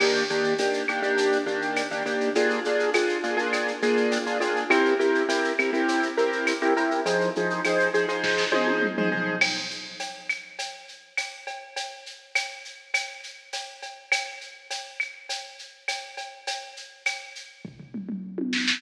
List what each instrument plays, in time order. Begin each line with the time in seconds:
0.00 acoustic grand piano D#3 A#3 D4 G4, crash, cowbell, claves
0.15 shaker
0.29 acoustic grand piano D#3 A#3 D4 G4, shaker
0.44 shaker
0.59 acoustic grand piano D#3 A#3 D4 G4, tambourine, cowbell, shaker
0.73 shaker
0.88 acoustic grand piano D#3 A#3 D4 G4, claves, shaker
1.02 acoustic grand piano D#3 A#3 D4 G4, shaker
1.17 cowbell, shaker
1.32 shaker
1.46 acoustic grand piano D#3 A#3 D4 G4, shaker
1.62 shaker
1.76 tambourine, cowbell, claves, shaker
1.91 acoustic grand piano D#3 A#3 D4 G4, shaker
2.06 acoustic grand piano D#3 A#3 D4 G4, cowbell, shaker
2.20 shaker
2.35 acoustic grand piano A#3 D4 F4 G#4, cowbell, shaker
2.50 shaker
2.65 acoustic grand piano A#3 D4 F4 G#4, shaker
2.79 shaker
2.94 acoustic grand piano A#3 D4 F4 G#4, tambourine, cowbell, claves, shaker
3.09 shaker
3.23 acoustic grand piano A#3 D4 F4 G#4, shaker
3.37 acoustic grand piano A#3 D4 F4 G#4, shaker
3.53 cowbell, claves, shaker
3.68 shaker
3.82 acoustic grand piano A#3 D4 F4 G#4, shaker
3.97 shaker
4.12 tambourine, cowbell, shaker
4.26 acoustic grand piano A#3 D4 F4 G#4, shaker
4.40 acoustic grand piano A#3 D4 F4 G#4, cowbell, shaker
4.56 shaker
4.70 acoustic grand piano C4 E4 G4 A#4, cowbell, claves, shaker
4.85 shaker
4.99 acoustic grand piano C4 E4 G4 A#4, shaker
5.15 shaker
5.29 acoustic grand piano C4 E4 G4 A#4, tambourine, cowbell, shaker
5.44 shaker
5.59 acoustic grand piano C4 E4 G4 A#4, claves, shaker
5.73 acoustic grand piano C4 E4 G4 A#4, shaker
5.88 cowbell, shaker
6.03 shaker
6.17 acoustic grand piano C4 E4 G4 A#4, shaker
6.32 shaker
6.47 tambourine, cowbell, claves, shaker
6.62 acoustic grand piano C4 E4 G4 A#4, shaker
6.77 acoustic grand piano C4 E4 G4 A#4, cowbell, shaker
6.91 shaker
7.05 acoustic grand piano F3 D#4 G#4 C5, cowbell, shaker
7.21 shaker
7.36 acoustic grand piano F3 D#4 G#4 C5, shaker
7.50 shaker
7.65 acoustic grand piano F3 D#4 G#4 C5, tambourine, cowbell, claves, shaker
7.79 shaker
7.94 acoustic grand piano F3 D#4 G#4 C5, shaker
8.08 acoustic grand piano F3 D#4 G#4 C5, shaker
8.24 kick, snare
8.38 snare
8.52 acoustic grand piano F3 D#4 G#4 C5, high tom
8.68 high tom
8.82 mid tom
8.97 acoustic grand piano F3 D#4 G#4 C5, mid tom
9.12 acoustic grand piano F3 D#4 G#4 C5, floor tom
9.41 crash, cowbell, claves
9.71 shaker
10.00 tambourine, cowbell, shaker
10.29 claves, shaker
10.59 cowbell, shaker
10.88 shaker
11.17 tambourine, cowbell, claves, shaker
11.47 cowbell, shaker
11.76 cowbell, shaker
12.06 shaker
12.35 tambourine, cowbell, claves, shaker
12.65 shaker
12.94 cowbell, claves, shaker
13.23 shaker
13.53 tambourine, cowbell, shaker
13.82 cowbell, shaker
14.12 cowbell, claves, shaker
14.41 shaker
14.71 tambourine, cowbell, shaker
15.00 claves, shaker
15.29 cowbell, shaker
15.59 shaker
15.88 tambourine, cowbell, claves, shaker
16.17 cowbell, shaker
16.47 cowbell, shaker
16.76 shaker
17.06 tambourine, cowbell, claves, shaker
17.35 shaker
17.65 kick, floor tom
17.80 floor tom
17.94 mid tom
18.09 mid tom
18.38 high tom
18.53 snare
18.68 snare